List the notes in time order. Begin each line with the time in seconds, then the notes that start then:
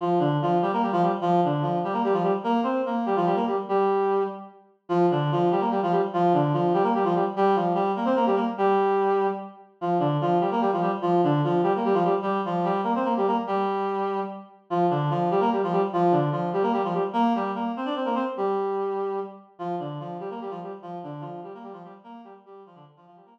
0.01 F3 F4
0.19 D3 D4
0.42 F3 F4
0.62 G3 G4
0.73 A#3 A#4
0.82 G3 G4
0.92 F3 F4
1.02 G3 G4
1.21 F3 F4
1.44 D3 D4
1.62 F3 F4
1.84 G3 G4
1.93 A#3 A#4
2.04 G3 G4
2.13 F3 F4
2.23 G3 G4
2.44 A#3 A#4
2.63 C4 C5
2.86 A#3 A#4
3.06 G3 G4
3.16 F3 F4
3.26 G3 G4
3.36 A#3 A#4
3.47 G3 G4
3.69 G3 G4
4.89 F3 F4
5.11 D3 D4
5.32 F3 F4
5.51 G3 G4
5.61 A#3 A#4
5.71 G3 G4
5.83 F3 F4
5.92 G3 G4
6.13 F3 F4
6.34 D3 D4
6.53 F3 F4
6.74 G3 G4
6.83 A#3 A#4
6.95 G3 G4
7.05 F3 F4
7.15 G3 G4
7.36 G3 G4
7.56 F3 F4
7.75 G3 G4
7.96 A#3 A#4
8.05 C4 C5
8.16 A#3 A#4
8.26 G3 G4
8.35 A#3 A#4
8.58 G3 G4
9.81 F3 F4
9.99 D3 D4
10.21 F3 F4
10.40 G3 G4
10.51 A#3 A#4
10.61 G3 G4
10.73 F3 F4
10.82 G3 G4
11.02 F3 F4
11.24 D3 D4
11.44 F3 F4
11.63 G3 G4
11.76 A#3 A#4
11.85 G3 G4
11.94 F3 F4
12.05 G3 G4
12.22 G3 G4
12.45 F3 F4
12.64 G3 G4
12.84 A#3 A#4
12.95 C4 C5
13.04 A#3 A#4
13.17 G3 G4
13.27 A#3 A#4
13.47 G3 G4
14.70 F3 F4
14.90 D3 D4
15.10 F3 F4
15.31 G3 G4
15.40 A#3 A#4
15.52 G3 G4
15.63 F3 F4
15.72 G3 G4
15.93 F3 F4
16.12 D3 D4
16.32 F3 F4
16.53 G3 G4
16.62 A#3 A#4
16.73 G3 G4
16.84 F3 F4
16.94 G3 G4
17.13 A#3 A#4
17.35 G3 G4
17.55 A#3 A#4
17.76 C4 C5
17.85 D4 D5
17.96 C4 C5
18.05 A#3 A#4
18.15 C4 C5
18.37 G3 G4
19.59 F3 F4
19.79 D3 D4
20.00 F3 F4
20.20 G3 G4
20.30 A#3 A#4
20.41 G3 G4
20.50 F3 F4
20.63 G3 G4
20.82 F3 F4
21.03 D3 D4
21.21 F3 F4
21.43 G3 G4
21.54 A#3 A#4
21.63 G3 G4
21.73 F3 F4
21.84 G3 G4
22.04 A#3 A#4
22.24 G3 G4
22.46 G3 G4
22.66 F3 F4
22.75 D3 D4
22.96 F3 F4
23.07 F3 F4
23.16 G3 G4
23.26 A#3 A#4